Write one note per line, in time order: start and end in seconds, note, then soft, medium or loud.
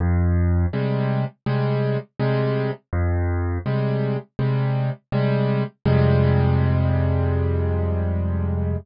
0.00 0.66 F2 loud
0.73 1.24 C3 medium
0.73 1.24 G3 medium
0.73 1.24 G#3 medium
1.46 1.97 C3 medium
1.46 1.97 G3 medium
1.46 1.97 G#3 medium
2.20 2.71 C3 loud
2.20 2.71 G3 medium
2.20 2.71 G#3 loud
2.93 3.59 F2 loud
3.66 4.17 C3 medium
3.66 4.17 G3 medium
3.66 4.17 G#3 medium
4.39 4.90 C3 medium
4.39 4.90 G3 medium
4.39 4.90 G#3 medium
5.12 5.63 C3 medium
5.12 5.63 G3 loud
5.12 5.63 G#3 medium
5.85 8.76 F2 loud
5.85 8.76 C3 loud
5.85 8.76 G3 medium
5.85 8.76 G#3 loud